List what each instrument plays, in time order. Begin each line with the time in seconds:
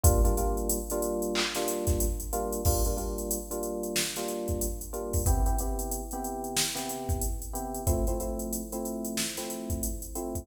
0.04 electric piano 1 G3 A#3 D4 F4, kick, closed hi-hat
0.24 electric piano 1 G3 A#3 D4 F4, closed hi-hat
0.37 electric piano 1 G3 A#3 D4 F4, closed hi-hat
0.57 closed hi-hat
0.70 closed hi-hat
0.90 electric piano 1 G3 A#3 D4 F4, closed hi-hat
1.02 closed hi-hat
1.22 closed hi-hat
1.35 clap
1.55 electric piano 1 G3 A#3 D4 F4, snare, closed hi-hat
1.68 closed hi-hat
1.87 kick, snare, closed hi-hat
2.00 closed hi-hat
2.20 closed hi-hat
2.33 electric piano 1 G3 A#3 D4 F4, closed hi-hat
2.52 closed hi-hat
2.65 electric piano 1 G3 A#3 D4 F4, kick, crash
2.85 electric piano 1 G3 A#3 D4 F4, closed hi-hat
2.97 electric piano 1 G3 A#3 D4 F4, closed hi-hat
3.18 closed hi-hat
3.31 closed hi-hat
3.51 electric piano 1 G3 A#3 D4 F4, closed hi-hat
3.63 closed hi-hat
3.83 closed hi-hat
3.96 snare
4.16 electric piano 1 G3 A#3 D4 F4, snare, closed hi-hat
4.28 closed hi-hat
4.48 kick, closed hi-hat
4.61 closed hi-hat
4.81 closed hi-hat
4.93 electric piano 1 G3 A#3 D4 F4, closed hi-hat
5.13 kick, open hi-hat
5.26 electric piano 1 C3 B3 E4 G4, kick, closed hi-hat
5.46 electric piano 1 C3 B3 E4 G4, closed hi-hat
5.59 electric piano 1 C3 B3 E4 G4, closed hi-hat
5.79 closed hi-hat
5.91 closed hi-hat
6.11 electric piano 1 C3 B3 E4 G4, closed hi-hat
6.24 closed hi-hat
6.44 closed hi-hat
6.57 snare
6.75 electric piano 1 C3 B3 E4 G4, snare, closed hi-hat
6.89 closed hi-hat
7.09 kick, closed hi-hat
7.21 closed hi-hat
7.42 closed hi-hat
7.54 electric piano 1 C3 B3 E4 G4, closed hi-hat
7.75 closed hi-hat
7.87 electric piano 1 F3 A3 C4 E4, kick, closed hi-hat
8.07 electric piano 1 F3 A3 C4 E4, closed hi-hat
8.20 electric piano 1 F3 A3 C4 E4, closed hi-hat
8.39 closed hi-hat
8.53 closed hi-hat
8.72 electric piano 1 F3 A3 C4 E4, closed hi-hat
8.85 closed hi-hat
9.05 closed hi-hat
9.17 snare
9.37 electric piano 1 F3 A3 C4 E4, snare, closed hi-hat
9.50 closed hi-hat
9.70 kick, closed hi-hat
9.83 closed hi-hat
10.02 closed hi-hat
10.15 electric piano 1 F3 A3 C4 E4, closed hi-hat
10.35 kick, closed hi-hat